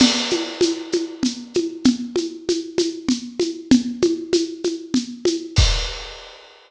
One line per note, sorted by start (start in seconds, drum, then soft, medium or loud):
0.00 crash loud
0.00 low conga loud
0.00 shaker loud
0.30 high conga medium
0.30 shaker medium
0.61 high conga loud
0.61 shaker loud
0.92 high conga medium
0.92 shaker medium
1.23 low conga medium
1.23 shaker loud
1.54 high conga medium
1.54 shaker medium
1.84 low conga loud
1.84 shaker medium
2.16 high conga medium
2.16 shaker medium
2.49 high conga medium
2.49 shaker medium
2.78 high conga medium
2.78 shaker loud
3.09 low conga loud
3.09 shaker medium
3.40 high conga medium
3.40 shaker medium
3.71 low conga loud
3.71 shaker medium
4.02 high conga loud
4.02 shaker medium
4.33 high conga loud
4.33 shaker loud
4.64 high conga medium
4.64 shaker medium
4.94 low conga loud
4.94 shaker medium
5.25 high conga loud
5.25 shaker medium
5.56 kick loud
5.56 crash loud